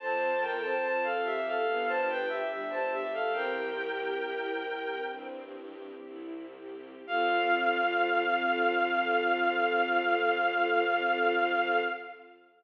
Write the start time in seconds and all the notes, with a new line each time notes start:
0.00 F2 C4 F4 A4 C5 A5
0.41 A4 A#4 G5
0.63 C5 A5
0.83 F2 F4 C5 A5
1.04 A4 F5
1.24 G4 A4 E5
1.47 A4 F5
1.67 G1 B3 D4 G4
1.87 C5 A5
2.08 G4 B4 G5
2.28 G4 E5
2.50 G1 G3 D4 G4 E5
2.70 C5 A5
2.92 G4 E5
3.14 A4 F5
3.32 C2 C4 E4 G4 A#4 G5
3.76 G4
4.19 C2 E4
4.63 G4
5.09 G2 C4
5.56 G4
6.05 C2 E4
6.54 G4
7.06 F2 C4 F4 A4 F5